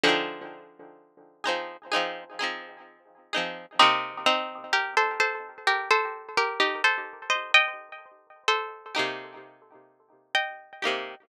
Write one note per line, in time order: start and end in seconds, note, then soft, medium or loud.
0.04 2.31 D3 medium
0.04 2.31 F3 loud
0.04 0.70 C4 medium
0.04 0.70 D#4 medium
0.04 0.70 G#4 medium
1.44 1.77 C4 medium
1.44 1.77 D#4 medium
1.44 1.77 G#4 medium
1.48 1.77 F3 medium
1.92 2.24 C4 medium
1.92 2.24 D#4 loud
1.92 2.24 G#4 loud
1.96 2.24 F3 medium
2.39 3.05 C4 medium
2.39 3.05 D#4 medium
2.39 3.05 G#4 medium
2.44 3.05 F3 medium
3.33 3.66 C4 medium
3.33 3.66 D#4 medium
3.33 3.66 G#4 medium
3.38 3.66 F3 medium
3.79 4.45 C3 loud
3.79 4.45 A#3 medium
3.79 4.21 C4 loud
3.79 4.21 D#4 loud
3.79 4.45 G4 loud
4.26 4.64 C4 loud
4.26 4.64 D#4 loud
4.73 4.95 G4 medium
4.73 4.95 A#4 loud
4.97 5.19 A4 medium
4.97 5.19 C5 loud
5.20 5.58 A4 medium
5.20 5.58 C5 loud
5.67 5.89 G4 loud
5.67 5.89 A#4 loud
5.91 6.29 A4 loud
5.91 6.29 C5 loud
6.38 6.59 G4 medium
6.38 6.60 A#4 loud
6.60 6.82 D#4 medium
6.60 6.82 G4 medium
6.84 7.24 A4 medium
6.84 7.24 C5 loud
7.30 7.52 C5 medium
7.30 7.52 D#5 loud
7.54 8.43 D#5 loud
7.54 8.43 G5 loud
8.48 10.19 A4 medium
8.48 10.19 C5 loud
8.95 9.60 A#3 medium
8.95 9.60 D#4 medium
8.95 9.60 G4 medium
8.99 9.60 C3 medium
10.35 11.22 D#5 loud
10.35 11.22 G5 loud
10.82 11.15 A#3 medium
10.82 11.15 D#4 medium
10.82 11.15 G4 medium
10.87 11.15 C3 medium